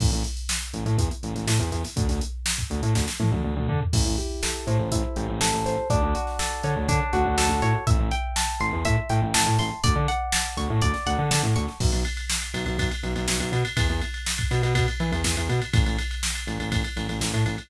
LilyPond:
<<
  \new Staff \with { instrumentName = "Acoustic Guitar (steel)" } { \time 4/4 \key a \dorian \tempo 4 = 122 r1 | r1 | e'8 g'8 a'8 c''8 e'8 g'8 a'8 c''8 | d'8 fis'8 a'8 cis''8 d'8 fis'8 a'8 cis''8 |
e''8 g''8 a''8 c'''8 e''8 g''8 a''8 c'''8 | d''8 fis''8 a''8 cis'''8 d''8 fis''8 a''8 cis'''8 | \key b \dorian r1 | r1 |
r1 | }
  \new Staff \with { instrumentName = "Synth Bass 1" } { \clef bass \time 4/4 \key a \dorian a,,16 a,,4~ a,,16 a,,16 a,16 e,8 a,,16 a,,16 a,16 e,16 e,8 | d,16 d,4~ d,16 d,16 a,16 d,8 a,16 d,16 d,16 d,16 d8 | a,,16 a,,4~ a,,16 a,16 a,,16 a,,8 a,,16 a,,16 a,,16 a,,16 a,,8 | d,16 d,4~ d,16 d16 d,16 d8 d,16 d,16 d,16 d,16 a,8 |
a,,16 a,,4~ a,,16 a,,16 e,16 a,8 a,16 a,,16 a,,16 a,16 a,,8 | d,16 d4~ d16 d,16 a,16 d,8 d,16 d16 d16 a,16 d,8 | \key b \dorian b,,16 b,,4~ b,,16 b,,16 b,,16 b,,8 b,,16 b,,16 b,,16 b,,16 b,8 | e,16 e,4~ e,16 b,16 b,16 b,8 e16 e,16 e,16 e,16 b,8 |
a,,16 a,,4~ a,,16 a,,16 a,,16 a,,8 a,,16 a,,16 a,,16 a,16 a,,8 | }
  \new DrumStaff \with { instrumentName = "Drums" } \drummode { \time 4/4 <cymc bd>16 hh16 <hh sn>16 hh16 sn16 hh16 hh16 hh16 <hh bd>16 hh16 hh16 <hh sn>16 sn16 hh16 <hh sn>16 <hho sn>16 | <hh bd>16 <hh sn>16 hh8 sn16 <hh bd>16 hh16 hh16 <bd sn>16 sn16 tommh16 tommh16 r16 toml16 tomfh16 tomfh16 | <cymc bd>8 hh8 sn8 hh8 <hh bd>8 hh8 sn8 <hh sn>8 | <hh bd>8 hh16 sn16 sn8 hh8 <hh bd>8 hh8 sn8 hh8 |
<hh bd>8 hh8 sn8 hh8 <hh bd>8 hh8 sn8 hho8 | <hh bd>8 hh8 sn8 hh8 <hh bd>16 sn16 <hh sn>8 sn8 hh16 sn16 | <cymc bd>16 <cymr sn>16 cymr16 cymr16 sn16 <cymr sn>16 cymr16 cymr16 <bd cymr>16 cymr16 cymr16 cymr16 sn16 <cymr sn>16 <cymr sn>16 cymr16 | <bd cymr>16 cymr16 cymr16 cymr16 sn16 <bd cymr>16 <cymr sn>16 cymr16 <bd cymr>16 cymr16 cymr16 cymr16 sn16 cymr16 cymr16 cymr16 |
<bd cymr>16 cymr16 cymr16 cymr16 sn16 <cymr sn>16 cymr16 cymr16 <bd cymr>16 cymr16 cymr16 cymr16 sn16 cymr16 cymr16 cymr16 | }
>>